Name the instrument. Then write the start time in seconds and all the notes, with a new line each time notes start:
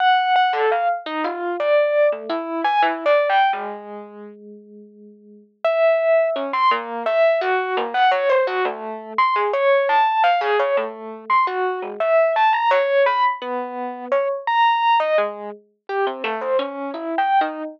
electric piano 1
0.00 F#5
0.36 F#5
0.53 A4
0.71 F5
1.06 D#4
1.24 F4
1.59 D5
2.12 A3
2.29 E4
2.64 G#5
2.82 E4
3.06 D5
3.29 G5
3.53 G#3
5.64 E5
6.35 C#4
6.53 C6
6.71 A#3
7.05 E5
7.41 F#4
7.77 A#3
7.94 F#5
8.11 C#5
8.29 C5
8.47 F#4
8.65 A3
9.18 C6
9.35 G#4
9.53 C#5
9.89 A5
10.23 F5
10.41 G#4
10.59 C#5
10.77 A3
11.30 C6
11.47 F#4
11.82 G#3
12.00 E5
12.36 A5
12.52 A#5
12.70 C#5
13.06 B5
13.41 B3
14.11 C#5
14.47 A#5
15.00 D#5
15.18 G#3
15.89 G4
16.06 C4
16.24 A3
16.41 C5
16.59 C#4
16.94 E4
17.18 G5
17.41 D#4